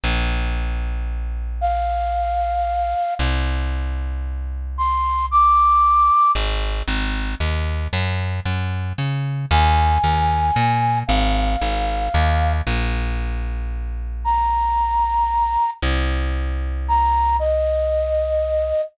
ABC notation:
X:1
M:3/4
L:1/8
Q:1/4=114
K:Bbmix
V:1 name="Flute"
z6 | f6 | z6 | c'2 d'4 |
[K:Abmix] z6 | z6 | a6 | f6 |
[K:Bbmix] z6 | b6 | z4 b2 | e6 |]
V:2 name="Electric Bass (finger)" clef=bass
B,,,6- | B,,,6 | C,,6- | C,,6 |
[K:Abmix] A,,,2 A,,,2 E,,2 | G,,2 G,,2 D,2 | E,,2 E,,2 B,,2 | A,,,2 A,,,2 E,,2 |
[K:Bbmix] B,,,6- | B,,,6 | C,,6- | C,,6 |]